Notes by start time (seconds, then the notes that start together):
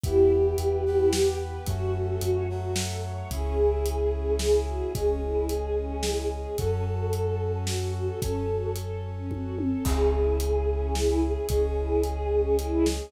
0.04 E2 B3 E4 G4, kick, closed hi-hat
0.31 G4
0.58 E2 B4, closed hi-hat
0.86 B3 E4 G4 B4
1.13 G4, snare
1.40 B4
1.66 F#2 A3 C#4 F#4, kick, closed hi-hat
1.95 A4
2.21 F#2 C#5, closed hi-hat
2.49 F#3 A3 F#4
2.76 A4, snare
3.04 C#5
3.31 C#2 C#4 E4 G#4, kick, closed hi-hat
3.58 E4
3.86 G#4, closed hi-hat
4.13 C#4
4.39 E4 G#4, snare
4.67 F#4 G#4
4.95 C#2 G#3 C#4 G#4, kick, closed hi-hat
5.22 E4
5.49 G#4, closed hi-hat
5.76 C#4
6.03 E4, snare
6.31 G#4
6.58 F#2 C#4 F#4 A4, kick, closed hi-hat
6.86 F#4
7.13 A4, closed hi-hat
7.40 C#4
7.67 F#4, snare
7.95 F#4 A4
8.22 F#2 C#4 A4 C#5, kick, closed hi-hat
8.49 F#4
8.76 A4, closed hi-hat
9.04 C#4
9.31 F#4, kick, high tom
9.58 A4, high tom
9.85 C#2 C#4 E4 G#4, kick, crash
10.13 E4
10.40 G#4, closed hi-hat
10.68 C#4
10.95 E4, snare
11.22 G#4
11.49 C#2 G#3 C#4 G#4, kick, closed hi-hat
11.77 E4
12.03 G#4, closed hi-hat
12.31 C#4
12.58 E4, closed hi-hat
12.86 G#4, snare